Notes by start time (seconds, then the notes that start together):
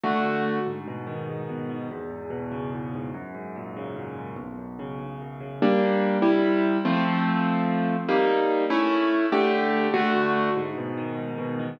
0.04 D3 A3 F#4
0.66 G#2
0.88 B2
1.07 D#3
1.29 G#2
1.49 B2
1.70 D#3
1.91 E2
2.10 G#2
2.30 B2
2.52 C#3
2.73 E2
2.94 G#2
3.14 F#2
3.34 G#2
3.56 A#2
3.76 C#3
3.96 F#2
4.17 G#2
4.36 B1
4.58 F#2
4.79 C#3
4.99 B1
5.21 F#2
5.40 C#3
5.62 G3 A#3 D4
6.22 C3 G3 E4
6.85 F3 A3 C4
8.08 G3 A#3 D#4
8.70 A3 C#4 E4
9.32 D3 A3 G4
9.94 D3 A3 F#4
10.56 G#2
10.77 B2
10.97 D#3
11.18 G#2
11.38 B2
11.59 D#3